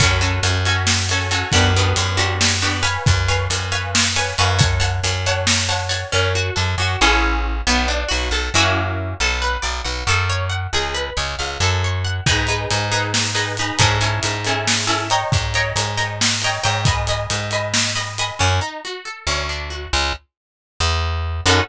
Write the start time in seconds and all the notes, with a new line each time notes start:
0.00 F#2 C#4 F#4 A4, kick, closed hi-hat
0.21 C#4 F#4 A4, closed hi-hat
0.43 F#2, closed hi-hat
0.65 C#4 F#4 A4, closed hi-hat
0.87 snare
1.09 C#4 F#4 A4, closed hi-hat
1.31 C#4 F#4 A4, closed hi-hat
1.52 F#2 B3 D4 F#4 G4, kick, closed hi-hat
1.76 B3 D4 F#4 G4, closed hi-hat
1.96 F#2, closed hi-hat
2.17 B3 D4 F#4 G4, closed hi-hat
2.41 snare
2.62 B3 D4 F#4 G4, closed hi-hat
2.83 B4 C#5 F5 G#5, closed hi-hat
3.06 F#2, kick, closed hi-hat
3.28 B4 C#5 F5 G#5, closed hi-hat
3.50 F#2, closed hi-hat
3.72 B4 C#5 F5 G#5, closed hi-hat
3.95 snare
4.16 B4 C#5 F5 G#5, closed hi-hat
4.38 F#2 B4 C#5 F5 G#5, closed hi-hat
4.59 C#5 F#5 A5, kick, closed hi-hat
4.80 C#5 F#5 A5, closed hi-hat
5.03 F#2, closed hi-hat
5.26 C#5 F#5 A5, closed hi-hat
5.47 snare
5.69 C#5 F#5 A5, closed hi-hat
5.89 C#5 F#5 A5, closed hi-hat
6.12 F#2 C#4
6.35 F#4
6.56 F#2 A4
6.78 F#2 F#4
7.01 A1 C#4 E4 G#4 A4
7.67 B1 B3
7.88 D4
8.08 B1 F#4
8.31 B1 A4
8.54 F#2 A#3 C#4 E4 F#4
9.20 B1 A4
9.42 B4
9.62 B1 D5
9.84 B1 F#5
10.07 F#2 A4
10.30 C#5
10.50 F#5
10.73 C#2 G#4
10.94 B4
11.17 C#2 C#5
11.39 C#2 F5
11.60 F#2 A4
11.84 C#5
12.05 F#5
12.26 G#2 D#4 G#4 B4, kick, closed hi-hat
12.47 D#4 G#4 B4, closed hi-hat
12.71 G#2, closed hi-hat
12.92 D#4 G#4 B4, closed hi-hat
13.14 snare
13.35 D#4 G#4 B4, closed hi-hat
13.57 D#4 G#4 B4, closed hi-hat
13.79 G#2 C#4 E4 G#4 A4, kick, closed hi-hat
14.01 C#4 E4 G#4 A4, closed hi-hat
14.23 G#2, closed hi-hat
14.45 C#4 E4 G#4 A4, closed hi-hat
14.67 snare
14.87 C#4 E4 G#4 A4, closed hi-hat
15.10 C#5 D#5 G5 A#5, closed hi-hat
15.32 G#2, kick, closed hi-hat
15.54 C#5 D#5 G5 A#5, closed hi-hat
15.76 G#2, closed hi-hat
15.97 C#5 D#5 G5 A#5, closed hi-hat
16.21 snare
16.42 C#5 D#5 G5 A#5, closed hi-hat
16.64 G#2 C#5 D#5 G5 A#5, closed hi-hat
16.85 D#5 G#5 B5, kick, closed hi-hat
17.07 D#5 G#5 B5, closed hi-hat
17.30 G#2, closed hi-hat
17.51 D#5 G#5 B5, closed hi-hat
17.74 snare
17.95 D#5 G#5 B5, closed hi-hat
18.18 D#5 G#5 B5, closed hi-hat
18.39 F#2 C#4
18.61 D#4
18.85 F#4
19.05 A4
19.27 D2 C#4
19.49 D4
19.70 F#4
19.93 C#2
20.80 E2
21.46 F#2 C#4 D#4 F#4 A4